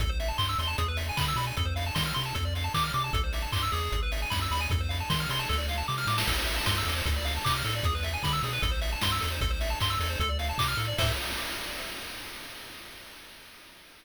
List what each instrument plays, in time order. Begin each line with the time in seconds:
0.00 synth bass 1 A1, lead 1 (square) A4, kick, closed hi-hat
0.09 lead 1 (square) C5
0.20 lead 1 (square) E5, open hi-hat
0.28 lead 1 (square) A5
0.38 synth bass 1 G2, lead 1 (square) C6, kick, clap
0.49 lead 1 (square) E6
0.59 synth bass 1 E2, lead 1 (square) C6, open hi-hat
0.67 lead 1 (square) A5
0.78 synth bass 1 E2, lead 1 (square) G#4, kick, closed hi-hat
0.88 lead 1 (square) B4
0.97 lead 1 (square) E5, open hi-hat
1.09 lead 1 (square) G#5
1.17 synth bass 1 D3, lead 1 (square) B5, kick, clap
1.28 lead 1 (square) E6
1.36 synth bass 1 B2, lead 1 (square) B5, open hi-hat
1.47 lead 1 (square) G#5
1.57 synth bass 1 F2, lead 1 (square) A4, kick, closed hi-hat
1.65 lead 1 (square) C5
1.76 lead 1 (square) F5, open hi-hat
1.86 lead 1 (square) A5
1.95 synth bass 1 D#3, lead 1 (square) C6, kick, snare
2.06 lead 1 (square) F6
2.14 synth bass 1 C3, lead 1 (square) C6, open hi-hat
2.26 lead 1 (square) A5
2.35 synth bass 1 F2, lead 1 (square) A4, kick, closed hi-hat
2.45 lead 1 (square) D5
2.55 lead 1 (square) F5, open hi-hat
2.64 lead 1 (square) A5
2.74 synth bass 1 D#3, lead 1 (square) D6, kick, clap
2.84 lead 1 (square) F6
2.93 synth bass 1 C3, lead 1 (square) D6, open hi-hat
3.04 lead 1 (square) A5
3.13 synth bass 1 A1, lead 1 (square) A4, kick, closed hi-hat
3.24 lead 1 (square) C5
3.33 lead 1 (square) E5, open hi-hat
3.42 lead 1 (square) A5
3.52 synth bass 1 G2, lead 1 (square) C6, kick, clap
3.63 lead 1 (square) E6
3.72 synth bass 1 E2, lead 1 (square) G#4, open hi-hat
3.92 synth bass 1 G#1, kick, closed hi-hat
4.03 lead 1 (square) B4
4.12 lead 1 (square) E5, open hi-hat
4.22 lead 1 (square) G#5
4.30 synth bass 1 F#2, lead 1 (square) B5, kick, snare
4.42 lead 1 (square) E6
4.51 synth bass 1 D#2, lead 1 (square) B5, open hi-hat
4.60 lead 1 (square) G#5
4.70 synth bass 1 F2, lead 1 (square) A4, kick, closed hi-hat
4.81 lead 1 (square) C5
4.89 lead 1 (square) F5, open hi-hat
5.00 lead 1 (square) A5
5.10 synth bass 1 D#3, lead 1 (square) C6, kick, snare
5.20 lead 1 (square) F6
5.29 synth bass 1 C3, lead 1 (square) C6, open hi-hat
5.39 lead 1 (square) A5
5.49 synth bass 1 D2, lead 1 (square) A4, kick, snare
5.58 lead 1 (square) D5
5.69 lead 1 (square) F5, snare
5.78 lead 1 (square) A5
5.88 synth bass 1 C3, lead 1 (square) D6, snare
5.98 lead 1 (square) F6, snare
6.07 synth bass 1 A2, lead 1 (square) D6, snare
6.18 lead 1 (square) A5, snare
6.27 synth bass 1 A1, lead 1 (square) A4, kick, crash
6.38 lead 1 (square) C5
6.47 lead 1 (square) E5, open hi-hat
6.56 lead 1 (square) A5
6.66 synth bass 1 G2, lead 1 (square) C6, kick, snare
6.78 lead 1 (square) E6
6.85 synth bass 1 E2, lead 1 (square) A4, open hi-hat
6.96 lead 1 (square) C5
7.05 synth bass 1 D2, lead 1 (square) A4, kick, closed hi-hat
7.16 lead 1 (square) D5
7.25 lead 1 (square) F5, open hi-hat
7.36 lead 1 (square) A5
7.44 synth bass 1 C3, lead 1 (square) D6, kick, clap
7.55 lead 1 (square) F6
7.65 synth bass 1 A2, lead 1 (square) A4, open hi-hat
7.75 lead 1 (square) D5
7.83 synth bass 1 E2, lead 1 (square) G#4, kick, closed hi-hat
7.95 lead 1 (square) B4
8.03 lead 1 (square) E5, open hi-hat
8.13 lead 1 (square) G#5
8.23 synth bass 1 D3, lead 1 (square) B5, kick, snare
8.33 lead 1 (square) E6
8.43 synth bass 1 B2, lead 1 (square) G#4, open hi-hat
8.53 lead 1 (square) B4
8.62 synth bass 1 A1, lead 1 (square) A4, kick, closed hi-hat
8.71 lead 1 (square) C5
8.81 lead 1 (square) E5, open hi-hat
8.92 lead 1 (square) A5
9.01 synth bass 1 G2, lead 1 (square) C6, kick, snare
9.12 lead 1 (square) E6
9.21 synth bass 1 E2, lead 1 (square) A4, open hi-hat
9.32 lead 1 (square) C5
9.41 synth bass 1 A1, lead 1 (square) A4, kick, closed hi-hat
9.50 lead 1 (square) C5
9.61 lead 1 (square) E5, open hi-hat
9.70 lead 1 (square) A5
9.80 synth bass 1 G2, lead 1 (square) C6, kick, clap
9.90 lead 1 (square) E6
10.00 synth bass 1 E2, lead 1 (square) A4, open hi-hat
10.10 lead 1 (square) C5
10.20 synth bass 1 D2, lead 1 (square) A4, kick, closed hi-hat
10.29 lead 1 (square) D5
10.39 lead 1 (square) F5, open hi-hat
10.49 lead 1 (square) A5
10.58 synth bass 1 C3, lead 1 (square) D6, kick, clap
10.68 lead 1 (square) F6
10.77 synth bass 1 A2, lead 1 (square) A4, open hi-hat
10.88 lead 1 (square) D5
10.98 synth bass 1 A2, lead 1 (square) A4 C5 E5, kick, crash